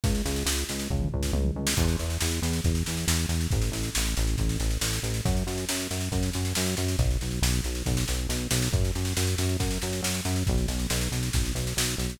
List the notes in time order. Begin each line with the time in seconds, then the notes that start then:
0.04 C#2, kick, snare
0.15 snare
0.25 C#2, snare
0.36 snare
0.46 C#2, snare
0.58 snare
0.69 C#2, snare
0.79 snare
0.90 C#2, kick
1.01 mid tom
1.12 C#2, floor tom
1.23 snare
1.33 C#2, high tom
1.45 mid tom
1.56 C#2
1.67 snare
1.77 E2, kick, snare, crash
1.88 snare
1.99 E2, snare
2.10 snare
2.21 E2, snare
2.31 snare
2.42 E2, snare
2.53 snare
2.64 E2, kick, snare
2.75 snare
2.86 E2, snare
2.97 snare
3.08 E2, snare
3.19 snare
3.29 E2, snare
3.41 snare
3.51 A1, kick, snare
3.62 snare
3.72 A1, snare
3.83 snare
3.95 A1, snare
4.05 snare
4.17 A1, snare
4.27 snare
4.38 A1, kick, snare
4.49 snare
4.59 A1, snare
4.70 snare
4.81 A1, snare
4.93 snare
5.03 A1, snare
5.14 snare
5.25 F#2, kick, snare
5.37 snare
5.47 F#2, snare
5.58 snare
5.69 F#2, snare
5.80 snare
5.91 F#2, snare
6.01 snare
6.12 F#2, kick, snare
6.23 snare
6.33 F#2, snare
6.45 snare
6.55 F#2, snare
6.66 snare
6.77 F#2, snare
6.88 snare
6.99 B1, kick, snare
7.11 snare
7.21 B1, snare
7.31 snare
7.42 B1, snare
7.53 snare
7.64 B1, snare
7.75 snare
7.86 B1, kick, snare
7.97 snare
8.08 B1, snare
8.29 B1, snare
8.51 B1, snare
8.62 snare
8.73 F#2, kick, snare
8.85 snare
8.95 F#2, snare
9.05 snare
9.17 F#2, snare
9.27 snare
9.38 F#2, snare
9.49 snare
9.60 F#2, kick, snare
9.71 snare
9.82 F#2, snare
9.93 snare
10.03 F#2, snare
10.14 snare
10.25 F#2, snare
10.36 snare
10.47 B1, kick, snare
10.58 snare
10.68 B1, snare
10.79 snare
10.90 B1, snare
11.01 snare
11.12 B1, snare
11.23 snare
11.33 B1, kick, snare
11.45 snare
11.55 B1, snare
11.67 snare
11.77 B1, snare
11.88 snare
11.98 B1, snare
12.10 snare